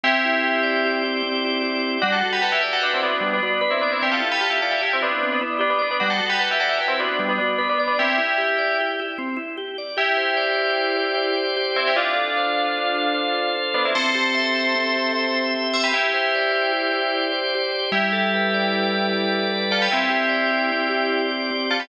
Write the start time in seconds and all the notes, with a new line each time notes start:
0.03 C4 E4 G4
0.25 E4
0.43 G4
0.63 D5
0.85 G4
1.04 E4
1.23 C4
1.44 E4
1.63 G4
1.83 D5
2.02 G3 D4 F#4
2.12 F#4 A4
2.23 F#4
2.33 G4 B4
2.42 F#4 A4 B4
2.52 E4 G4
2.61 E4 G4 D5
2.73 F#4 A4
2.81 D4 F#4 B4
2.94 C4 E4
3.03 B3 D4 F#4
3.21 G3
3.33 B3 D4
3.43 B3 D4 F#4
3.61 B3 D4 B4
3.71 C4 E4
3.81 B3 D4 D5
3.92 C4 E4
4.02 C4 E4 G4
4.12 F4 A4
4.20 E4
4.32 G4 B4
4.41 F4 G4 A4
4.50 E4 G4
4.62 F4 A4 D5
4.71 E4 G4
4.81 E4 G4
4.93 C4 E4
5.00 B3 D4 E4
5.23 C4
5.32 B3 D4
5.41 B3 D4 E4
5.59 B3 D4 G4
5.70 B3 D4
5.79 B3 D4 D5
5.91 B3 D4
6.00 G3 D4 F#4
6.10 F#4 A4
6.19 F#4
6.30 G4 B4
6.39 F#4 A4 B4
6.51 E4 G4
6.60 F#4 A4 D5
6.69 E4 G4
6.79 E4 G4 B4
6.88 C4 E4
7.00 B3 D4 F#4
7.19 G3
7.29 B3 D4
7.38 B3 D4 F#4
7.58 B3 D4 B4
7.69 B3 D4
7.78 B3 D4 D5
7.88 B3 D4
7.99 C4 E4 G4
8.18 E4
8.38 G4
8.58 D5
8.80 G4
9.00 E4
9.18 C4
9.37 E4
9.57 G4
9.78 D5
9.97 E4 G4
10.17 C5
10.37 D5
10.57 C5
10.78 G4
10.97 C5
11.17 D5
11.37 C5
11.57 G4
11.76 C4 E4 C5
11.87 E4 G4
11.96 D4 F4
12.16 A4
12.37 C5
12.58 A4
12.77 F4
12.95 A4
13.14 C5
13.35 A4
13.56 F4
13.74 B3 D4 A4
13.85 C4 E4
13.95 C4 A4 C5
14.15 G4
14.35 E5
14.55 G4
14.75 C4
14.95 G4
15.13 E5
15.34 G4
15.55 C4
15.74 G4 C5 E5
15.84 G4 B4
15.92 E4 G4
16.14 C5
16.35 D5
16.52 C5
16.73 G4
16.93 C5
17.14 D5
17.32 C5
17.55 G4
17.72 C5
17.92 G3 E4 G4
18.12 A4
18.34 B4
18.54 D5
18.73 B4
18.93 A4
19.13 G3
19.33 A4
19.51 B4
19.70 F4 A4 D5
19.82 G4 B4
19.92 C4 E4 G4
20.10 G4
20.29 D5
20.51 G4
20.72 C4
20.89 G4
21.12 D5
21.31 G4
21.51 C4
21.70 F4 G4 A4
21.80 G4 B4